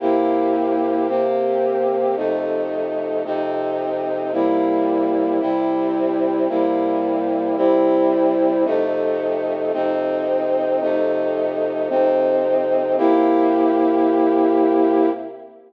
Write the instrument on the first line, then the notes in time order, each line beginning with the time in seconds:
brass section
0.00 C3 A#3 E4 G4
1.08 C3 A#3 C4 G4
2.16 F2 C3 A3 D#4
3.25 F2 C3 C4 D#4
4.32 C3 G3 A#3 E4
5.40 C3 G3 C4 E4
6.49 C3 G3 A#3 E4
7.57 C3 G3 C4 E4
8.65 F2 C3 A3 D#4
9.73 F2 C3 C4 D#4
10.81 F2 C3 A3 D#4
11.89 F2 C3 C4 D#4
12.97 C3 A#3 E4 G4